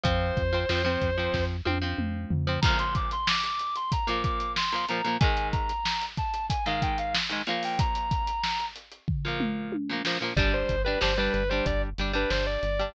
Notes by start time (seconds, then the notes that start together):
0.03 F2 F3 C4 C5, kick, closed hi-hat
0.37 F2, kick, closed hi-hat
0.53 F3 C4
0.69 F2 F3 C4, snare
0.84 F3 C4
1.01 F2, kick, closed hi-hat
1.18 F3 C4
1.34 F2, kick, snare
1.65 F2 F3 C4, high tom
1.82 F3 C4
1.98 F2, mid tom
2.31 F2, floor tom
2.47 F3 C4
2.62 A#2 F3 A#5, kick, crash
2.67 A#3
2.79 C6, closed hi-hat
2.95 D6, kick, closed hi-hat
3.11 C6, closed hi-hat
3.27 D6, snare
3.44 D6, closed hi-hat
3.59 closed hi-hat
3.76 C6, closed hi-hat
3.92 A#5, kick, closed hi-hat
4.07 A#2 F3 A#3 D6, closed hi-hat
4.24 D6, kick, closed hi-hat
4.40 closed hi-hat
4.56 C6, snare
4.72 A#2 F3 A#3, closed hi-hat
4.88 A#2 F3 A#3 A#5, closed hi-hat
5.04 A#2 F3 A#3, closed hi-hat
5.20 G#2 D#3 G#3 G#5, kick, closed hi-hat
5.37 closed hi-hat
5.52 A#5, kick, closed hi-hat
5.69 closed hi-hat
5.85 snare
6.01 closed hi-hat
6.17 A5, kick, closed hi-hat
6.34 closed hi-hat
6.49 G#5, kick, closed hi-hat
6.66 G#2 D#3 G#3 F5, closed hi-hat
6.82 G5, kick, closed hi-hat
6.98 F5, closed hi-hat
7.15 snare
7.29 G#2 D#3 G#3, closed hi-hat
7.47 A#2 F3 A#3 F5, closed hi-hat
7.63 G5, open hi-hat
7.79 A#5, kick, closed hi-hat
7.95 closed hi-hat
8.11 kick, closed hi-hat
8.27 closed hi-hat
8.43 snare
8.60 closed hi-hat
8.76 closed hi-hat
8.92 closed hi-hat
9.08 kick, floor tom
9.25 A#2 F3 A#3
9.40 mid tom
9.72 high tom
9.89 A#2 F3 A#3
10.05 A#2 F3 A#3, snare
10.21 A#2 F3 A#3
10.36 G1 G3 D4 D5, kick, crash
10.54 C5
10.69 G1, kick, closed hi-hat
10.85 G3 D4 B4
11.01 G1 G3 D4 C5, snare
11.18 G3 D4 B4
11.33 G1 B4, closed hi-hat
11.50 G3 D4 C5
11.66 G1 D5, kick, closed hi-hat
11.98 G1 G3 D4, snare, closed hi-hat
12.13 G3 D4 B4
12.30 G1 C5, snare
12.47 D5
12.63 G1, closed hi-hat
12.79 G3 D4